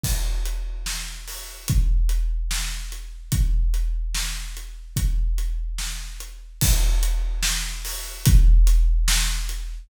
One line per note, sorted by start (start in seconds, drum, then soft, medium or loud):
0.04 kick medium
0.04 crash loud
0.46 closed hi-hat medium
0.86 snare loud
1.28 open hi-hat medium
1.68 kick loud
1.68 closed hi-hat loud
2.09 closed hi-hat medium
2.51 snare loud
2.92 closed hi-hat medium
3.32 kick loud
3.32 closed hi-hat loud
3.74 closed hi-hat medium
4.15 snare loud
4.57 closed hi-hat medium
4.96 kick loud
4.96 closed hi-hat medium
5.38 closed hi-hat medium
5.78 snare medium
6.20 closed hi-hat medium
6.61 kick loud
6.61 crash loud
7.03 closed hi-hat medium
7.43 snare loud
7.85 open hi-hat medium
8.26 kick loud
8.26 closed hi-hat loud
8.67 closed hi-hat medium
9.08 snare loud
9.49 closed hi-hat medium